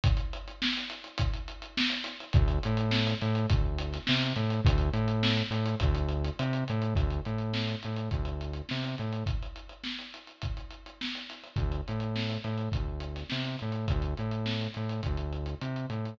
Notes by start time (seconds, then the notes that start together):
0.04 kick, closed hi-hat
0.17 closed hi-hat
0.33 closed hi-hat
0.48 closed hi-hat
0.62 snare
0.77 closed hi-hat
0.90 closed hi-hat
1.04 closed hi-hat
1.18 kick, closed hi-hat
1.34 closed hi-hat
1.48 closed hi-hat
1.62 closed hi-hat
1.77 snare
1.90 closed hi-hat
2.04 snare, closed hi-hat
2.20 closed hi-hat
2.33 D2, kick, closed hi-hat
2.48 closed hi-hat
2.63 A2, closed hi-hat
2.77 closed hi-hat
2.91 snare
3.07 closed hi-hat
3.22 A2, closed hi-hat
3.35 closed hi-hat
3.50 D2, kick, closed hi-hat
3.78 closed hi-hat
3.93 snare, closed hi-hat
4.07 C3, snare
4.22 closed hi-hat
4.36 A2, closed hi-hat
4.50 closed hi-hat
4.65 D2, kick, closed hi-hat
4.78 closed hi-hat
4.93 A2, closed hi-hat
5.08 closed hi-hat
5.23 snare
5.37 closed hi-hat
5.51 A2, closed hi-hat
5.66 closed hi-hat
5.80 D2, kick, closed hi-hat
5.95 closed hi-hat
6.09 closed hi-hat
6.25 closed hi-hat
6.39 C3, closed hi-hat
6.53 closed hi-hat
6.68 A2, closed hi-hat
6.82 closed hi-hat
6.95 D2, kick, closed hi-hat
7.10 closed hi-hat
7.25 A2, closed hi-hat
7.38 closed hi-hat
7.53 snare
7.68 closed hi-hat
7.83 A2, closed hi-hat
7.96 closed hi-hat
8.11 D2, kick, closed hi-hat
8.25 closed hi-hat
8.41 closed hi-hat
8.53 closed hi-hat
8.69 C3, snare
8.84 closed hi-hat
8.98 A2, closed hi-hat
9.13 closed hi-hat
9.26 kick, closed hi-hat
9.43 closed hi-hat
9.56 closed hi-hat
9.69 closed hi-hat
9.84 snare
9.99 closed hi-hat
10.14 closed hi-hat
10.27 closed hi-hat
10.42 kick, closed hi-hat
10.57 closed hi-hat
10.71 closed hi-hat
10.86 closed hi-hat
11.01 snare
11.15 closed hi-hat
11.29 snare, closed hi-hat
11.44 closed hi-hat
11.56 D2, kick, closed hi-hat
11.72 closed hi-hat
11.88 A2, closed hi-hat
12.00 closed hi-hat
12.16 snare
12.30 closed hi-hat
12.44 A2, closed hi-hat
12.58 closed hi-hat
12.72 D2, kick, closed hi-hat
13.00 closed hi-hat
13.16 snare, closed hi-hat
13.30 C3, snare
13.44 closed hi-hat
13.59 A2, closed hi-hat
13.72 closed hi-hat
13.88 D2, kick, closed hi-hat
14.02 closed hi-hat
14.17 A2, closed hi-hat
14.31 closed hi-hat
14.46 snare
14.61 closed hi-hat
14.74 A2, closed hi-hat
14.89 closed hi-hat
15.03 D2, kick, closed hi-hat
15.17 closed hi-hat
15.33 closed hi-hat
15.46 closed hi-hat
15.61 C3, closed hi-hat
15.76 closed hi-hat
15.90 A2, closed hi-hat
16.05 closed hi-hat